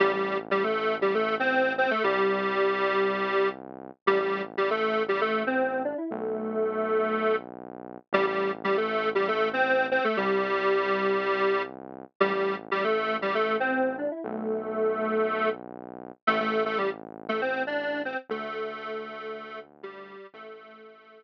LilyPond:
<<
  \new Staff \with { instrumentName = "Lead 1 (square)" } { \time 4/4 \key a \minor \tempo 4 = 118 <g g'>16 <g g'>8 r16 <g g'>16 <a a'>8. <g g'>16 <a a'>8 <c' c''>8. <c' c''>16 <a a'>16 | <g g'>2. r4 | <g g'>16 <g g'>8 r16 <g g'>16 <a a'>8. <g g'>16 <a a'>8 <c' c''>8. <d' d''>16 <e' e''>16 | <a a'>2. r4 |
<g g'>16 <g g'>8 r16 <g g'>16 <a a'>8. <g g'>16 <a a'>8 <c' c''>8. <c' c''>16 <a a'>16 | <g g'>2. r4 | <g g'>16 <g g'>8 r16 <g g'>16 <a a'>8. <g g'>16 <a a'>8 <c' c''>8. <d' d''>16 <e' e''>16 | <a a'>2. r4 |
<a a'>16 <a a'>8 <a a'>16 <g g'>16 r8. <a a'>16 <c' c''>8 <d' d''>8. <c' c''>16 r16 | <a a'>2. <g g'>4 | <a a'>2 r2 | }
  \new Staff \with { instrumentName = "Synth Bass 1" } { \clef bass \time 4/4 \key a \minor a,,1 | c,1 | a,,1 | b,,1 |
a,,1 | c,1 | a,,1 | b,,1 |
a,,1 | d,1 | a,,1 | }
>>